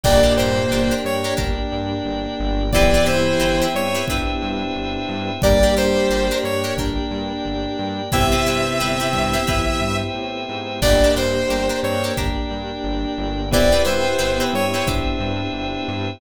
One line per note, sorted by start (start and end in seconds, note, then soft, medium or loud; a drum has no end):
0.04 0.25 G1 medium
0.04 0.92 A#2 medium
0.04 0.92 A#3 medium
0.04 2.70 A#3 medium
0.04 0.20 D4 medium
0.04 2.70 D4 medium
0.04 0.20 G4 medium
0.04 2.70 G4 medium
0.04 2.71 A#4 medium
0.04 0.20 A#4 medium
0.04 2.71 D5 medium
0.04 0.33 D5 loud
0.04 2.71 G5 medium
0.04 kick medium
0.04 crash loud
0.23 0.34 D4 medium
0.23 0.34 G4 medium
0.23 0.34 A#4 medium
0.37 0.59 G2 medium
0.37 0.67 D4 medium
0.37 0.67 G4 medium
0.37 0.67 A#4 medium
0.37 0.94 C5 medium
0.71 0.92 G1 medium
0.71 0.88 D4 medium
0.71 0.88 G4 medium
0.71 0.88 A#4 medium
0.91 1.17 D4 medium
0.91 1.17 G4 medium
0.91 1.17 A#4 medium
1.04 1.26 G2 medium
1.04 1.34 C#5 medium
1.24 1.35 D4 medium
1.24 1.35 G4 medium
1.24 1.35 A#4 medium
1.37 1.59 G1 medium
1.37 1.94 D4 medium
1.37 2.63 D4 medium
1.37 1.94 G4 medium
1.37 1.94 A#4 medium
1.37 kick medium
1.72 1.93 G2 medium
2.05 2.26 G1 medium
2.39 2.95 G1 medium
2.72 3.67 E3 medium
2.72 5.38 B3 medium
2.72 5.38 C4 medium
2.72 2.91 C4 medium
2.72 5.38 E4 medium
2.72 3.67 E4 loud
2.72 2.91 E4 loud
2.72 5.38 G4 medium
2.72 2.91 G4 loud
2.72 5.41 B4 medium
2.72 2.91 B4 medium
2.72 5.41 C5 medium
2.72 3.05 D5 loud
2.72 5.41 E5 medium
2.72 5.41 G5 medium
2.72 kick medium
2.94 3.05 C4 medium
2.94 3.05 E4 medium
2.94 3.05 G4 medium
2.94 3.05 B4 medium
3.06 3.28 G2 medium
3.06 3.34 C4 medium
3.06 3.34 E4 medium
3.06 3.34 G4 medium
3.06 3.34 B4 medium
3.06 3.65 C5 medium
3.39 3.61 G1 medium
3.39 3.56 C4 medium
3.39 3.56 E4 medium
3.39 3.56 G4 medium
3.39 3.56 B4 medium
3.62 3.87 C4 medium
3.62 3.87 E4 medium
3.62 3.87 G4 medium
3.62 3.87 B4 medium
3.74 3.96 G2 medium
3.74 4.05 C#5 loud
3.95 4.05 C4 medium
3.95 4.05 E4 medium
3.95 4.05 G4 medium
3.95 4.05 B4 medium
4.08 4.29 G1 medium
4.08 4.66 C4 medium
4.08 5.32 D4 medium
4.08 4.66 E4 medium
4.08 4.66 G4 medium
4.08 4.66 B4 medium
4.08 kick medium
4.42 4.63 G2 medium
4.76 4.97 G1 medium
5.08 5.30 G2 medium
5.42 5.64 G1 medium
5.42 6.28 G3 medium
5.42 8.09 A#3 medium
5.42 5.59 D4 medium
5.42 8.09 D4 medium
5.42 6.28 G4 medium
5.42 8.09 G4 medium
5.42 5.59 G4 medium
5.42 8.11 A#4 medium
5.42 5.59 A#4 medium
5.42 5.75 D5 loud
5.42 8.11 D5 medium
5.42 8.11 G5 medium
5.42 kick loud
5.63 5.74 D4 medium
5.63 5.74 G4 medium
5.63 5.74 A#4 medium
5.76 5.98 G2 medium
5.76 6.05 D4 medium
5.76 6.05 G4 medium
5.76 6.05 A#4 medium
5.76 6.38 C5 medium
6.09 6.31 G1 medium
6.09 6.27 D4 medium
6.09 6.27 G4 medium
6.09 6.27 A#4 medium
6.31 6.57 D4 medium
6.31 6.57 G4 medium
6.31 6.57 A#4 medium
6.44 6.65 G2 medium
6.44 6.74 C#5 medium
6.64 6.75 D4 medium
6.64 6.75 G4 medium
6.64 6.75 A#4 medium
6.77 6.98 G1 medium
6.77 8.02 D4 medium
6.77 7.35 D4 medium
6.77 7.35 G4 medium
6.77 7.35 A#4 medium
6.77 kick medium
7.11 7.32 G2 medium
7.45 7.67 G1 medium
7.79 8.01 G2 medium
8.12 8.34 G1 medium
8.12 9.37 C3 medium
8.12 10.78 B3 medium
8.12 8.28 C4 medium
8.12 9.37 C4 loud
8.12 10.78 C4 medium
8.12 8.28 E4 medium
8.12 10.78 E4 medium
8.12 10.78 G4 medium
8.12 8.28 G4 medium
8.12 10.80 B4 medium
8.12 8.28 B4 medium
8.12 10.80 C5 medium
8.12 10.80 E5 medium
8.12 9.97 E5 loud
8.12 10.80 G5 medium
8.12 kick medium
8.32 8.43 C4 medium
8.32 8.43 E4 medium
8.32 8.43 G4 medium
8.32 8.43 B4 medium
8.46 8.68 G2 medium
8.46 8.75 C4 medium
8.46 8.75 E4 medium
8.46 8.75 G4 medium
8.46 8.75 B4 medium
8.80 9.02 G1 medium
8.80 8.96 C4 medium
8.80 8.96 E4 medium
8.80 8.96 G4 medium
8.80 8.96 B4 medium
9.00 9.25 C4 medium
9.00 9.25 E4 medium
9.00 9.25 G4 medium
9.00 9.25 B4 medium
9.13 9.36 G2 medium
9.13 kick medium
9.33 9.44 C4 medium
9.33 9.44 E4 medium
9.33 9.44 G4 medium
9.33 9.44 B4 medium
9.47 9.69 G1 medium
9.47 9.80 E3 medium
9.47 10.04 C4 medium
9.47 10.04 E4 medium
9.47 9.80 E4 medium
9.47 10.04 G4 medium
9.47 10.04 B4 medium
9.47 kick medium
9.81 10.02 G2 medium
10.15 10.46 A2 medium
10.49 10.80 G#2 medium
10.82 11.03 G1 medium
10.82 13.48 A#3 medium
10.82 10.98 D4 medium
10.82 11.10 D4 medium
10.82 13.48 D4 medium
10.82 10.98 G4 medium
10.82 13.48 G4 medium
10.82 13.50 A#4 medium
10.82 10.98 A#4 medium
10.82 11.15 D5 loud
10.82 11.10 D5 medium
10.82 13.50 D5 medium
10.82 13.50 G5 medium
10.82 kick medium
10.82 crash loud
11.04 11.15 D4 medium
11.04 11.15 G4 medium
11.04 11.15 A#4 medium
11.15 11.37 G2 medium
11.15 11.45 D4 medium
11.15 11.45 G4 medium
11.15 11.45 A#4 medium
11.15 11.80 C5 medium
11.49 11.70 G1 medium
11.49 11.66 D4 medium
11.49 11.66 G4 medium
11.49 11.66 A#4 medium
11.69 11.95 D4 medium
11.69 11.95 G4 medium
11.69 11.95 A#4 medium
11.82 12.04 G2 medium
11.82 12.15 C4 medium
11.82 12.15 C5 medium
11.82 12.13 C#5 medium
12.04 12.15 D4 medium
12.04 12.15 G4 medium
12.04 12.15 A#4 medium
12.16 12.38 G1 medium
12.16 13.41 D4 medium
12.16 12.74 D4 medium
12.16 12.74 G4 medium
12.16 12.74 A#4 medium
12.16 kick medium
12.51 12.72 G2 medium
12.84 13.05 G1 medium
13.18 13.73 G1 medium
13.51 16.17 B3 medium
13.51 14.51 B3 medium
13.51 16.17 C4 medium
13.51 13.69 C4 medium
13.51 16.17 E4 medium
13.51 13.69 E4 loud
13.51 16.17 G4 medium
13.51 13.69 G4 loud
13.51 16.19 B4 medium
13.51 14.51 B4 medium
13.51 13.69 B4 medium
13.51 16.19 C5 medium
13.51 13.82 D5 loud
13.51 16.19 E5 medium
13.51 16.19 G5 medium
13.51 kick medium
13.72 13.83 C4 medium
13.72 13.83 E4 medium
13.72 13.83 G4 medium
13.72 13.83 B4 medium
13.85 14.07 G2 medium
13.85 14.13 C4 medium
13.85 14.13 E4 medium
13.85 14.13 G4 medium
13.85 14.13 B4 medium
13.85 14.43 C5 medium
14.19 14.40 G1 medium
14.19 14.35 C4 medium
14.19 14.35 E4 medium
14.19 14.35 G4 medium
14.19 14.35 B4 medium
14.40 14.66 C4 medium
14.40 14.66 E4 medium
14.40 14.66 G4 medium
14.40 14.66 B4 medium
14.53 14.74 G2 medium
14.53 14.87 C#5 medium
14.74 14.85 C4 medium
14.74 14.85 E4 medium
14.74 14.85 G4 medium
14.74 14.85 B4 medium
14.86 15.08 G1 medium
14.86 15.44 C4 medium
14.86 16.11 D4 medium
14.86 15.44 E4 medium
14.86 15.44 G4 medium
14.86 15.44 B4 medium
14.86 kick medium
15.20 15.41 G2 medium
15.54 15.75 G1 medium
15.88 16.10 G2 medium